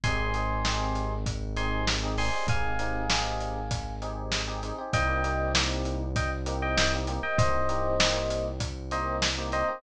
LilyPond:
<<
  \new Staff \with { instrumentName = "Electric Piano 1" } { \time 4/4 \key c \minor \tempo 4 = 98 <aes'' c'''>2 r8 <aes'' c'''>8 r8 <aes'' c'''>8 | <f'' aes''>2~ <f'' aes''>8 r4. | <ees'' g''>4 r4 <ees'' g''>16 r8 <ees'' g''>16 <ees'' g''>16 r8 <ees'' g''>16 | <c'' ees''>2 r8 <c'' ees''>8 r8 <c'' ees''>8 | }
  \new Staff \with { instrumentName = "Electric Piano 1" } { \time 4/4 \key c \minor <c' ees' g' aes'>8 <c' ees' g' aes'>8 <c' ees' g' aes'>4. <c' ees' g' aes'>8. <c' ees' g' aes'>16 <c' ees' g' aes'>16 <c' ees' g' aes'>16~ | <c' ees' g' aes'>8 <c' ees' g' aes'>8 <c' ees' g' aes'>4. <c' ees' g' aes'>8. <c' ees' g' aes'>16 <c' ees' g' aes'>16 <c' ees' g' aes'>16 | <bes c' ees' g'>8 <bes c' ees' g'>8 <bes c' ees' g'>4. <bes c' ees' g'>8. <bes c' ees' g'>16 <bes c' ees' g'>16 <bes c' ees' g'>16~ | <bes c' ees' g'>8 <bes c' ees' g'>8 <bes c' ees' g'>4. <bes c' ees' g'>8. <bes c' ees' g'>16 <bes c' ees' g'>16 <bes c' ees' g'>16 | }
  \new Staff \with { instrumentName = "Synth Bass 1" } { \clef bass \time 4/4 \key c \minor aes,,1 | aes,,1 | c,1 | c,1 | }
  \new DrumStaff \with { instrumentName = "Drums" } \drummode { \time 4/4 <hh bd>8 hh8 sn8 hh8 <hh bd>8 hh8 sn8 hho8 | <hh bd>8 hh8 sn8 hh8 <hh bd>8 hh8 sn8 hh8 | <hh bd>8 hh8 sn8 hh8 <hh bd>8 hh8 sn8 hh8 | <hh bd>8 hh8 sn8 hh8 <hh bd>8 hh8 sn8 hh8 | }
>>